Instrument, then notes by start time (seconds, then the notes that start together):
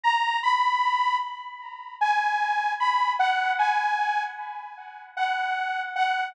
lead 2 (sawtooth)
0.03 A#5
0.43 B5
2.01 G#5
2.80 B5
3.19 F#5
3.59 G#5
5.17 F#5
5.96 F#5